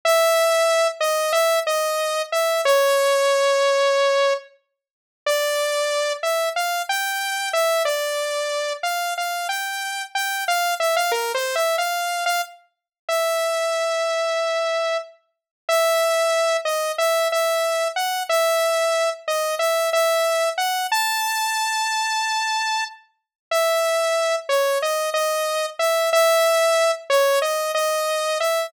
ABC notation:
X:1
M:4/4
L:1/16
Q:1/4=92
K:C#m
V:1 name="Lead 2 (sawtooth)"
e6 d2 e2 d4 e2 | c12 z4 | [K:Dm] d6 e2 f2 g4 e2 | d6 f2 f2 g4 g2 |
f2 e f (3B2 c2 e2 f3 f z4 | e12 z4 | [K:C#m] e6 d2 e2 e4 f2 | e6 d2 e2 e4 f2 |
a14 z2 | e6 c2 d2 d4 e2 | e6 c2 d2 d4 e2 |]